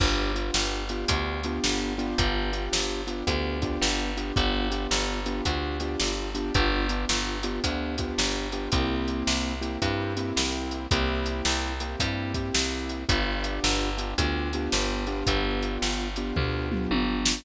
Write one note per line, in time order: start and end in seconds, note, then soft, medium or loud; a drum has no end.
0.00 0.51 G1 loud
0.00 0.32 B3 medium
0.00 0.32 D4 medium
0.00 0.32 F4 medium
0.00 0.32 G4 medium
0.00 kick medium
0.00 crash medium
0.35 0.84 B3 medium
0.35 0.84 D4 medium
0.35 0.84 F4 medium
0.35 0.84 G4 medium
0.35 closed hi-hat medium
0.54 1.05 G1 medium
0.54 snare medium
0.89 1.08 B3 medium
0.89 1.08 D4 medium
0.89 1.08 F4 medium
0.89 1.08 G4 medium
0.89 closed hi-hat medium
1.08 1.59 D2 medium
1.08 1.41 B3 medium
1.08 1.41 D4 medium
1.08 1.41 F4 medium
1.08 1.41 G4 medium
1.08 kick medium
1.08 closed hi-hat loud
1.43 1.93 B3 medium
1.43 1.93 D4 medium
1.43 1.93 F4 medium
1.43 1.93 G4 medium
1.43 closed hi-hat medium
1.64 2.14 G1 medium
1.64 snare medium
1.98 2.50 B3 medium
1.98 2.50 D4 medium
1.98 2.50 F4 medium
1.98 2.50 G4 medium
1.98 closed hi-hat medium
2.18 2.69 G1 loud
2.18 kick medium
2.18 closed hi-hat medium
2.53 3.02 B3 medium
2.53 3.02 D4 medium
2.53 3.02 F4 medium
2.53 3.02 G4 medium
2.53 closed hi-hat medium
2.73 3.23 G1 medium
2.73 snare medium
3.07 3.25 B3 medium
3.07 3.25 D4 medium
3.07 3.25 F4 medium
3.07 3.25 G4 medium
3.07 closed hi-hat medium
3.27 3.78 D2 medium
3.27 3.59 B3 medium
3.27 3.59 D4 medium
3.27 3.59 F4 medium
3.27 3.59 G4 medium
3.27 kick medium
3.27 closed hi-hat medium
3.62 4.11 B3 medium
3.62 4.11 D4 medium
3.62 4.11 F4 medium
3.62 4.11 G4 medium
3.62 kick medium
3.62 closed hi-hat medium
3.81 4.32 G1 medium
3.81 snare medium
4.17 4.35 B3 medium
4.17 4.35 D4 medium
4.17 4.35 F4 medium
4.17 4.35 G4 medium
4.17 closed hi-hat medium
4.36 4.87 G1 loud
4.36 4.68 B3 medium
4.36 4.68 D4 medium
4.36 4.68 F4 medium
4.36 4.68 G4 medium
4.36 kick medium
4.36 closed hi-hat medium
4.71 5.20 B3 medium
4.71 5.20 D4 medium
4.71 5.20 F4 medium
4.71 5.20 G4 medium
4.71 closed hi-hat medium
4.91 5.41 G1 medium
4.91 snare medium
5.26 5.44 B3 medium
5.26 5.44 D4 medium
5.26 5.44 F4 medium
5.26 5.44 G4 medium
5.26 closed hi-hat medium
5.45 5.96 D2 medium
5.45 5.78 B3 medium
5.45 5.78 D4 medium
5.45 5.78 F4 medium
5.45 5.78 G4 medium
5.45 kick medium
5.45 closed hi-hat medium
5.80 6.30 B3 medium
5.80 6.30 D4 medium
5.80 6.30 F4 medium
5.80 6.30 G4 medium
5.80 closed hi-hat medium
6.00 6.51 G1 medium
6.00 snare medium
6.35 6.53 B3 medium
6.35 6.53 D4 medium
6.35 6.53 F4 medium
6.35 6.53 G4 medium
6.35 closed hi-hat medium
6.54 7.06 G1 loud
6.54 6.87 B3 medium
6.54 6.87 D4 medium
6.54 6.87 F4 medium
6.54 6.87 G4 medium
6.54 kick medium
6.54 closed hi-hat medium
6.89 7.38 B3 medium
6.89 7.38 D4 medium
6.89 7.38 F4 medium
6.89 7.38 G4 medium
6.89 closed hi-hat medium
7.09 7.60 G1 medium
7.09 snare medium
7.43 7.62 B3 medium
7.43 7.62 D4 medium
7.43 7.62 F4 medium
7.43 7.62 G4 medium
7.43 closed hi-hat medium
7.64 8.14 D2 medium
7.64 7.96 B3 medium
7.64 7.96 D4 medium
7.64 7.96 F4 medium
7.64 7.96 G4 medium
7.64 kick medium
7.64 closed hi-hat medium
7.98 8.48 B3 medium
7.98 8.48 D4 medium
7.98 8.48 F4 medium
7.98 8.48 G4 medium
7.98 kick medium
7.98 closed hi-hat medium
8.18 8.69 G1 medium
8.18 snare medium
8.52 8.71 B3 medium
8.52 8.71 D4 medium
8.52 8.71 F4 medium
8.52 8.71 G4 medium
8.52 closed hi-hat medium
8.72 9.23 C2 medium
8.72 9.54 A#3 medium
8.72 9.54 C4 medium
8.72 9.54 E4 medium
8.72 9.54 G4 medium
8.72 kick medium
8.72 closed hi-hat medium
9.08 closed hi-hat medium
9.27 9.78 C2 medium
9.27 snare medium
9.61 9.80 A#3 medium
9.61 9.80 C4 medium
9.61 9.80 E4 medium
9.61 9.80 G4 medium
9.61 closed hi-hat medium
9.82 10.33 G2 medium
9.82 10.14 A#3 medium
9.82 10.14 C4 medium
9.82 10.14 E4 medium
9.82 10.14 G4 medium
9.82 kick medium
9.82 closed hi-hat medium
10.17 10.86 A#3 medium
10.17 10.86 C4 medium
10.17 10.86 E4 medium
10.17 10.86 G4 medium
10.17 closed hi-hat medium
10.36 10.87 C2 medium
10.36 snare medium
10.71 closed hi-hat medium
10.91 11.42 C2 loud
10.91 11.73 A#3 medium
10.91 11.73 C4 medium
10.91 11.73 E4 medium
10.91 11.73 G4 medium
10.91 kick medium
10.91 closed hi-hat medium
11.26 closed hi-hat medium
11.45 11.96 C2 medium
11.45 snare medium
11.80 11.99 A#3 medium
11.80 11.99 C4 medium
11.80 11.99 E4 medium
11.80 11.99 G4 medium
11.80 closed hi-hat medium
12.00 12.51 G2 medium
12.00 12.33 A#3 medium
12.00 12.33 C4 medium
12.00 12.33 E4 medium
12.00 12.33 G4 medium
12.00 kick medium
12.00 closed hi-hat medium
12.34 13.04 A#3 medium
12.34 13.04 C4 medium
12.34 13.04 E4 medium
12.34 13.04 G4 medium
12.34 kick medium
12.34 closed hi-hat medium
12.54 13.05 C2 medium
12.54 snare loud
12.89 closed hi-hat medium
13.09 13.60 G1 loud
13.09 13.90 B3 medium
13.09 13.90 D4 medium
13.09 13.90 F4 medium
13.09 13.90 G4 medium
13.09 kick medium
13.09 closed hi-hat medium
13.44 closed hi-hat medium
13.64 14.14 G1 medium
13.64 snare medium
13.98 14.16 B3 medium
13.98 14.16 D4 medium
13.98 14.16 F4 medium
13.98 14.16 G4 medium
13.98 closed hi-hat medium
14.18 14.69 D2 medium
14.18 14.50 B3 medium
14.18 14.50 D4 medium
14.18 14.50 F4 medium
14.18 14.50 G4 medium
14.18 kick medium
14.18 closed hi-hat medium
14.53 15.05 B3 medium
14.53 15.05 D4 medium
14.53 15.05 F4 medium
14.53 15.05 G4 medium
14.53 closed hi-hat medium
14.72 15.23 G1 medium
14.72 snare medium
15.07 16.08 B3 medium
15.07 16.08 D4 medium
15.07 16.08 F4 medium
15.07 16.08 G4 medium
15.07 closed hi-hat soft
15.27 15.78 G1 loud
15.27 kick medium
15.27 closed hi-hat medium
15.62 closed hi-hat medium
15.82 16.33 G1 medium
15.82 snare medium
16.16 16.35 B3 medium
16.16 16.35 D4 medium
16.16 16.35 F4 medium
16.16 16.35 G4 medium
16.16 closed hi-hat medium
16.36 16.87 D2 medium
16.36 16.68 B3 medium
16.36 16.68 D4 medium
16.36 16.68 F4 medium
16.36 16.68 G4 medium
16.36 kick medium
16.36 floor tom medium
16.71 17.41 B3 medium
16.71 17.41 D4 medium
16.71 17.41 F4 medium
16.71 17.41 G4 medium
16.71 mid tom medium
16.91 17.41 G1 medium
16.91 high tom medium
17.25 snare loud